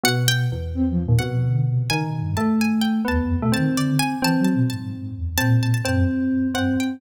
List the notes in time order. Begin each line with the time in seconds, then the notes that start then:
0.04 B2 F#5
0.28 G5
0.52 E2
0.74 C4
0.90 F3
1.05 D#2 A#2
1.19 B2 F#5
1.44 D3
1.67 C3
1.90 C#3 D#3 G#5
2.06 B2
2.22 G2
2.37 A3 A5
2.61 G#5
2.81 G5
3.05 D#2 B3 A5
3.22 F2
3.38 B2
3.42 A3
3.52 D#3 C4 A5
3.77 D3 D5
3.99 G#5
4.22 E3 C4 A5
4.39 F#3
4.45 A5
4.54 B2
4.70 G#2 A5
5.16 E2
5.37 A#2 C4 A5
5.63 A5
5.74 A5
5.85 F#2 C4 A5
6.54 G2 C4 F#5
6.80 G5